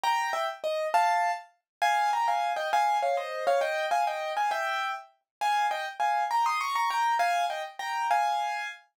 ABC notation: X:1
M:6/8
L:1/8
Q:3/8=134
K:Gm
V:1 name="Acoustic Grand Piano"
[gb]2 [=eg] z _e2 | [fa]3 z3 | [K:Fm] [fa]2 [gb] [fa]2 [eg] | [fa]2 [df] [ce]2 [df] |
[eg]2 [fa] [eg]2 [fa] | [=eg]3 z3 | [K:Ab] [fa]2 [eg] z [fa]2 | [gb] [c'e'] [bd'] [bd'] [gb]2 |
[fa]2 [eg] z [gb]2 | [fa]4 z2 |]